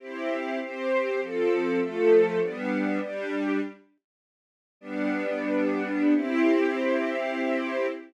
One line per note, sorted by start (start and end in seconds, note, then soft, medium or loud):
0.00 0.59 C4 medium
0.00 0.59 E4 medium
0.00 0.59 G4 medium
0.61 1.20 C4 medium
0.61 1.20 G4 medium
0.61 1.20 C5 medium
1.21 1.79 F3 medium
1.21 1.80 C4 medium
1.21 1.79 A4 medium
1.80 2.40 F3 medium
1.80 2.40 A3 medium
1.80 2.40 A4 medium
2.41 3.00 G3 medium
2.41 3.00 B3 medium
2.41 3.00 D4 medium
3.00 3.60 G3 loud
3.00 3.60 D4 medium
3.00 3.60 G4 medium
4.81 6.14 G3 medium
4.81 6.14 B3 medium
4.81 6.14 D4 loud
6.14 7.87 C4 loud
6.14 7.87 E4 loud
6.14 7.87 G4 loud